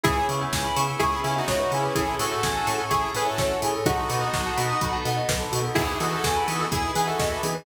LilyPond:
<<
  \new Staff \with { instrumentName = "Lead 2 (sawtooth)" } { \time 4/4 \key e \major \tempo 4 = 126 <e' gis'>8 r4. <e' gis'>8 <cis' e'>16 <dis' fis'>8. <cis' e'>8 | <e' gis'>8 <fis' a'>4. <e' gis'>8 <gis' b'>16 <fis' a'>8. r8 | <dis' fis'>2~ <dis' fis'>8 r4. | <e' gis'>8 <fis' a'>4. <e' gis'>8 <gis' b'>16 <fis' a'>8. r8 | }
  \new Staff \with { instrumentName = "Lead 2 (sawtooth)" } { \time 4/4 \key e \major <b cis' e' gis'>8 <b cis' e' gis'>4 <b cis' e' gis'>4 <b cis' e' gis'>4 <b cis' e' gis'>8 | <cis' e' gis' a'>8 <cis' e' gis' a'>4 <cis' e' gis' a'>4 <cis' e' gis' a'>4 <cis' e' gis' a'>8 | <b dis' fis' a'>8 <b dis' fis' a'>4 <b dis' fis' a'>4 <b dis' fis' a'>4 <b dis' fis' a'>8 | <b dis' e' gis'>8 <b dis' e' gis'>4 <b dis' e' gis'>4 <b dis' e' gis'>4 <b dis' e' gis'>8 | }
  \new Staff \with { instrumentName = "Tubular Bells" } { \time 4/4 \key e \major gis'16 b'16 cis''16 e''16 gis''16 b''16 cis'''16 e'''16 cis'''16 b''16 gis''16 e''16 cis''16 b'16 gis'16 b'16 | gis'16 a'16 cis''16 e''16 gis''16 a''16 cis'''16 e'''16 cis'''16 a''16 gis''16 e''16 cis''16 a'16 gis'16 a'16 | fis'16 a'16 b'16 dis''16 fis''16 a''16 b''16 dis'''16 b''16 a''16 fis''16 dis''16 b'16 a'16 fis'16 a'16 | gis'16 b'16 dis''16 e''16 gis''16 b''16 dis'''16 e'''16 dis'''16 b''16 gis''16 e''16 dis''16 b'16 gis'16 b'16 | }
  \new Staff \with { instrumentName = "Synth Bass 1" } { \clef bass \time 4/4 \key e \major cis,8 cis8 cis,8 cis8 cis,8 cis8 cis,8 cis8 | a,,8 a,8 a,,8 a,8 a,,8 a,8 a,,8 a,8 | b,,8 b,8 b,,8 b,8 b,,8 b,8 b,,8 b,8 | e,8 e8 e,8 e8 e,8 e8 e,8 e8 | }
  \new Staff \with { instrumentName = "Pad 5 (bowed)" } { \time 4/4 \key e \major <b cis' e' gis'>2 <b cis' gis' b'>2 | <cis' e' gis' a'>2 <cis' e' a' cis''>2 | <b dis' fis' a'>2 <b dis' a' b'>2 | <b dis' e' gis'>2 <b dis' gis' b'>2 | }
  \new DrumStaff \with { instrumentName = "Drums" } \drummode { \time 4/4 <hh bd>8 hho8 <bd sn>8 hho8 <hh bd>8 hho8 <bd sn>8 hho8 | <hh bd>8 hho8 <bd sn>8 hho8 <hh bd>8 hho8 <bd sn>8 hho8 | <hh bd>8 hho8 <bd sn>8 hho8 <hh bd>8 hho8 <bd sn>8 hho8 | <cymc bd>8 hho8 <bd sn>8 hho8 <hh bd>8 hho8 <bd sn>8 hho8 | }
>>